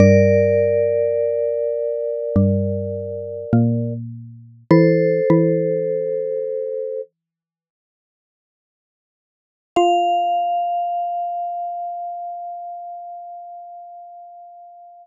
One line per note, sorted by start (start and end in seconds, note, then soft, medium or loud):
0.00 2.17 G2 loud
0.00 2.17 G3 loud
0.00 3.93 A#4 medium
0.00 3.93 D5 loud
2.36 3.45 G2 medium
2.36 3.45 G3 loud
3.53 4.64 A#2 medium
3.53 4.64 A#3 loud
4.71 5.21 E3 loud
4.71 5.21 E4 loud
4.71 7.01 A4 medium
4.71 7.01 C5 medium
5.30 7.92 E3 medium
5.30 7.92 E4 loud
9.76 15.07 F4 loud
9.76 15.07 F5 loud